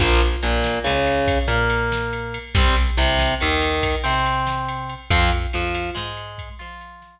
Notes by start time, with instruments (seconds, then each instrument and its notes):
0.00 electric bass (finger) A#1, overdriven guitar F3 A#3, kick, crash
0.21 ride
0.43 electric bass (finger) A#1, overdriven guitar A#2, ride
0.64 snare
0.84 electric bass (finger) C#2, overdriven guitar C#3, ride
1.07 ride
1.27 kick, ride
1.48 electric bass (finger) A#2, overdriven guitar A#3, ride
1.70 ride
1.92 snare
2.13 ride
2.34 ride
2.55 electric bass (finger) C2, overdriven guitar G3 C4, kick, ride
2.77 ride
2.97 electric bass (finger) C2, overdriven guitar C3, ride
3.19 snare
3.40 electric bass (finger) D#2, overdriven guitar D#3, ride
3.62 ride
3.83 kick, ride
4.04 electric bass (finger) C3, overdriven guitar C4, ride
4.26 ride
4.47 snare
4.69 ride
4.89 ride
5.10 electric bass (finger) F2, overdriven guitar F3 C4, kick, ride
5.31 ride
5.53 electric bass (finger) F2, overdriven guitar F3, ride
5.75 ride
5.95 electric bass (finger) G#2, overdriven guitar G#3, snare
6.17 ride
6.38 kick, ride
6.59 electric bass (finger) F3, overdriven guitar F4, ride
6.81 ride
7.02 snare